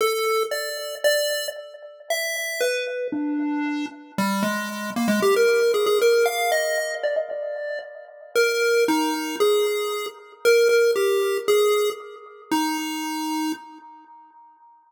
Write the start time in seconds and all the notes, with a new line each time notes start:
0.01 A4
0.51 D5
1.04 D5
2.10 E5
2.61 B4
3.12 D4
4.18 G3
4.43 G#3
4.96 A#3
5.08 G#3
5.22 G4
5.36 A#4
5.74 G#4
5.86 G#4
6.02 A#4
6.26 F5
6.52 D#5
7.03 D5
7.16 D#5
7.31 D5
8.35 A#4
8.88 D#4
9.40 G#4
10.45 A#4
10.69 A#4
10.96 G4
11.48 G#4
12.51 D#4